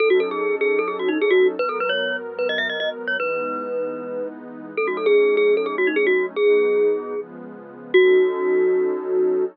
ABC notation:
X:1
M:4/4
L:1/16
Q:1/4=151
K:F#dor
V:1 name="Glockenspiel"
A F A G3 G2 A G F D G F2 z | B A B c3 z2 B d e d d z2 c | B12 z4 | A F A G3 G2 A G F D G F2 z |
G10 z6 | F16 |]
V:2 name="Pad 2 (warm)"
[F,CDA]16 | [G,,F,B,^A]16 | [E,G,B,D]16 | [F,A,CD]16 |
[G,,F,B,D]8 [C,^E,G,B,]8 | [F,CDA]16 |]